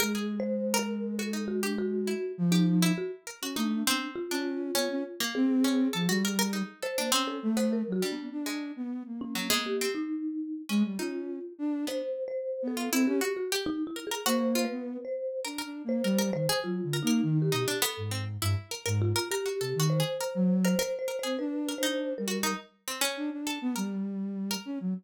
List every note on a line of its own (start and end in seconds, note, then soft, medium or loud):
0.00 2.14 G#3 medium
0.00 0.35 G#4 medium
0.00 0.13 A#4 loud
0.15 0.68 G#4 medium
0.40 0.75 C5 medium
0.74 1.14 A#4 loud
0.79 1.15 A#4 loud
1.19 1.32 F#4 medium
1.19 1.45 A4 medium
1.33 1.60 D#4 medium
1.48 1.61 F#4 medium
1.63 1.76 D4 soft
1.63 2.03 G4 medium
1.78 2.32 F#4 loud
2.07 2.48 E4 medium
2.38 2.91 F3 loud
2.52 2.92 D#4 medium
2.52 2.79 G4 medium
2.82 3.23 E4 loud
2.98 3.11 F#4 medium
3.27 3.40 A#4 medium
3.42 3.55 C#4 medium
3.42 3.56 F#4 medium
3.56 3.83 A3 loud
3.56 4.10 D4 medium
3.56 3.83 D#4 medium
3.86 4.00 B3 medium
3.86 4.27 C4 loud
4.15 5.22 F4 medium
4.31 4.71 C#4 medium
4.31 4.71 D4 medium
4.75 4.89 B3 medium
4.75 5.15 C#4 loud
4.90 5.03 C#4 loud
5.20 5.60 A#3 medium
5.35 5.88 C4 loud
5.35 6.69 G#4 medium
5.64 5.91 C#4 medium
5.93 6.08 F3 medium
5.93 6.07 A4 medium
6.09 6.62 G3 loud
6.09 6.22 F#4 medium
6.25 6.38 A#4 medium
6.39 6.52 A#4 loud
6.53 6.80 D#4 medium
6.83 6.96 A4 medium
6.83 7.10 C5 medium
6.98 7.11 A#3 medium
6.98 7.11 D4 medium
7.12 7.52 C4 loud
7.12 7.40 C#4 medium
7.27 7.54 A4 medium
7.43 7.83 A3 loud
7.57 7.97 B3 medium
7.57 7.70 C5 loud
7.73 7.91 A#4 medium
7.87 8.00 F#3 medium
7.92 8.10 F#4 loud
8.02 8.42 G3 medium
8.02 8.29 D4 medium
8.12 8.30 B3 medium
8.32 8.72 D4 medium
8.46 9.00 G#3 medium
8.76 9.03 B3 medium
9.06 9.86 A#3 soft
9.21 9.48 C#4 medium
9.35 9.49 F#3 medium
9.50 9.77 G#3 loud
9.50 9.64 B3 loud
9.66 9.93 G4 medium
9.81 10.61 C4 medium
9.95 10.62 D#4 medium
10.69 10.83 G#3 loud
10.69 10.96 C#4 medium
10.84 10.98 G3 medium
10.99 11.39 C#4 medium
10.99 11.79 D#4 medium
10.99 11.53 F4 medium
11.58 11.85 D4 loud
11.87 12.67 B3 medium
11.87 12.02 D4 soft
11.87 12.24 C5 medium
12.28 12.63 C5 medium
12.62 12.89 B3 medium
12.68 13.03 A4 medium
12.77 12.90 F4 medium
12.92 13.05 C4 loud
12.92 13.19 E4 loud
13.07 13.20 C#4 loud
13.07 13.34 G4 medium
13.21 13.48 F#4 medium
13.37 13.50 F#4 medium
13.52 13.92 G4 loud
13.66 13.84 D#4 loud
13.87 14.05 E4 loud
13.96 14.10 A#4 medium
14.07 14.25 G#4 medium
14.11 14.25 A#4 medium
14.26 14.66 A#3 medium
14.26 14.53 F#4 loud
14.26 14.62 C5 loud
14.55 15.36 F4 medium
14.65 15.00 B4 loud
14.70 14.97 B3 medium
15.05 15.40 C5 medium
15.45 15.62 D4 medium
15.45 15.58 A#4 medium
15.58 15.99 A#4 medium
15.64 15.82 D4 medium
15.84 16.02 A#3 medium
15.89 16.29 C5 medium
16.04 16.31 G3 loud
16.04 16.18 A#4 medium
16.18 16.32 A#4 medium
16.33 16.47 D#3 medium
16.33 16.60 C5 loud
16.49 16.89 G#4 loud
16.63 16.81 F#3 medium
16.63 16.99 F4 medium
16.83 17.01 D3 medium
16.93 17.07 A#4 medium
17.03 17.21 A#3 loud
17.03 17.38 D#4 medium
17.07 17.34 A#4 medium
17.23 17.50 D#3 loud
17.42 17.78 G4 medium
17.52 17.66 B2 loud
17.52 17.65 D#4 medium
17.68 17.81 D4 medium
17.82 18.09 B3 loud
17.82 18.09 A4 loud
17.97 18.37 G#2 medium
18.11 18.25 C4 medium
18.42 18.55 G2 loud
18.42 18.69 E4 medium
18.71 18.85 A#4 medium
18.86 19.13 G#2 loud
18.86 19.12 A#4 medium
19.02 19.28 F4 loud
19.16 19.29 A#4 loud
19.31 19.84 G4 medium
19.31 19.45 A#4 medium
19.46 19.59 F#4 soft
19.60 19.74 C3 medium
19.60 19.79 A4 medium
19.75 20.02 D#3 loud
19.80 19.97 F#4 medium
19.90 20.57 C5 medium
20.00 20.18 G#4 medium
20.21 20.34 A#4 medium
20.35 20.75 F#3 loud
20.65 20.78 A#4 medium
20.65 20.78 C5 medium
20.79 21.06 A#4 loud
20.79 20.97 C5 loud
20.99 21.17 C5 loud
21.08 21.21 A#4 medium
21.19 21.37 C5 medium
21.23 21.37 C4 medium
21.23 21.37 G#4 medium
21.38 21.74 D4 medium
21.38 21.74 B4 medium
21.69 21.82 A#4 medium
21.78 22.14 D4 medium
21.78 22.14 C5 medium
21.83 22.23 D#4 medium
22.18 22.54 G3 medium
22.18 22.54 A#4 medium
22.28 22.41 F#4 medium
22.43 22.57 D#4 loud
22.88 23.01 C4 medium
23.01 23.41 C#4 loud
23.17 23.30 D4 medium
23.32 23.59 D4 medium
23.47 23.73 A4 medium
23.61 23.75 B3 loud
23.76 24.56 G3 medium
23.76 24.02 A#4 medium
24.51 24.91 A#4 loud
24.65 24.79 C#4 medium
24.80 24.94 F#3 medium